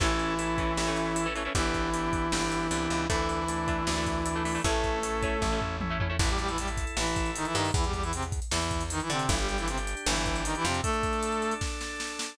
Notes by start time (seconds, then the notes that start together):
0.00 A1 E3 A3 C#4 E4 A4, kick, crash
0.19 closed hi-hat
0.39 C#4 E4 A4, closed hi-hat
0.58 E3 A3 C#4, kick, closed hi-hat
0.77 A1 C#4 E4 A4, snare
0.87 E3 A3 C#4
0.97 closed hi-hat
1.16 C#4 E4 A4, closed hi-hat
1.26 E3 A3 C#4
1.35 E3 A3 C#4, closed hi-hat
1.45 E3 A3 C#4
1.55 G1 E3 B3 D4 E4 G4, kick, closed hi-hat
1.74 kick, closed hi-hat
1.94 B3 D4 G4, closed hi-hat
2.13 kick, closed hi-hat
2.32 G1 B3 D4 G4, snare
2.52 closed hi-hat
2.71 C2 B3 D4 G4, closed hi-hat
2.90 C#2, closed hi-hat
3.09 D2 E3 A3 D4 E4, kick, closed hi-hat
3.29 closed hi-hat
3.48 A3 D4, closed hi-hat
3.68 A3 D4, kick, closed hi-hat
3.87 D2 A3 D4, snare
3.97 A3 D4
4.06 kick, closed hi-hat
4.26 A3 D4, closed hi-hat
4.36 A3 D4
4.45 A3 D4, open hi-hat
4.55 A3 D4
4.64 A1 A3 C#4 E4 A4, kick, closed hi-hat
4.84 kick, closed hi-hat
5.03 A3 C#4 E4, closed hi-hat
5.23 A3 C#4 E4, kick, closed hi-hat
5.42 A1 A3 C#4 E4, kick, high tom
5.52 A3 C#4 E4
5.61 floor tom
5.81 A3 C#4 E4, high tom
5.90 A3 C#4 E4
6.00 A3 C#4 E4, floor tom
6.10 A3 C#4 E4
6.19 A1 E3 E4 A4, kick, crash
6.29 G3 G4, closed hi-hat
6.39 G3 G4, closed hi-hat
6.48 E3 E4, closed hi-hat
6.58 G3 G4, closed hi-hat
6.68 closed hi-hat
6.77 kick, closed hi-hat
6.87 closed hi-hat
6.97 A1 E3 E4, snare
7.06 closed hi-hat
7.16 kick, closed hi-hat
7.26 closed hi-hat
7.36 D#3 D#4, closed hi-hat
7.45 E3 E4, closed hi-hat
7.54 G2 D#3 D#4, closed hi-hat
7.64 open hi-hat
7.74 E2 E3 E4, kick, closed hi-hat
7.84 G3 G4, closed hi-hat
7.93 G3 G4, kick, closed hi-hat
8.03 E3 E4, closed hi-hat
8.13 C3 C4, closed hi-hat
8.23 closed hi-hat
8.32 kick, closed hi-hat
8.42 closed hi-hat
8.51 E2 E3 E4, snare
8.61 closed hi-hat
8.71 kick, closed hi-hat
8.81 closed hi-hat
8.90 D#3 D#4, closed hi-hat
9.00 E3 E4, closed hi-hat
9.10 C3 D3 C4, closed hi-hat
9.19 closed hi-hat
9.28 G1 E3 D4 E4 G4, kick, closed hi-hat
9.39 G3 G4, closed hi-hat
9.48 G3 G4, closed hi-hat
9.58 E3 E4, closed hi-hat
9.68 C3 C4, closed hi-hat
9.78 closed hi-hat
9.87 closed hi-hat
9.97 closed hi-hat
10.06 G1 E3 E4, snare
10.16 closed hi-hat
10.26 kick, closed hi-hat
10.36 closed hi-hat
10.45 D#3 D#4, closed hi-hat
10.55 E3 E4, closed hi-hat
10.65 F2 C3 C4, closed hi-hat
10.74 closed hi-hat
10.83 A3 D4 A4, kick, closed hi-hat
10.93 closed hi-hat
11.03 kick, closed hi-hat
11.13 closed hi-hat
11.23 closed hi-hat
11.32 closed hi-hat
11.42 closed hi-hat
11.51 closed hi-hat
11.61 kick, snare
11.81 snare
12.00 snare
12.19 snare